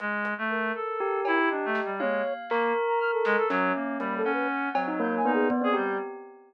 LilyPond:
<<
  \new Staff \with { instrumentName = "Clarinet" } { \time 4/4 \tempo 4 = 120 gis8. a8. a'4 e'8 \tuplet 3/2 { d'8 a8 g8 } | gis8 r8 ais8 r4 gis16 a'16 fis8 ais8 | g8 cis'4 fis4 dis'8 r16 gis'16 g8 | }
  \new Staff \with { instrumentName = "Flute" } { \time 4/4 r4 ais'2 dis''4 | cis''8. r4 ais''16 f'''16 a'8. r4 | \tuplet 3/2 { b''8 a'8 b'8 } r4 \tuplet 3/2 { g'''8 gis''8 gis'8 } d''8 g'''8 | }
  \new Staff \with { instrumentName = "Tubular Bells" } { \time 4/4 r2 g'2 | f''4 ais'2 cis'4 | ais8 fis''4 c'16 dis'16 ais8 b8 b16 c'16 g'8 | }
  \new DrumStaff \with { instrumentName = "Drums" } \drummode { \time 4/4 hh8 hh8 r4 r8 cb8 r8 sn8 | tommh4 hc4 r8 sn8 sn4 | hh4 r8 cb8 r4 bd4 | }
>>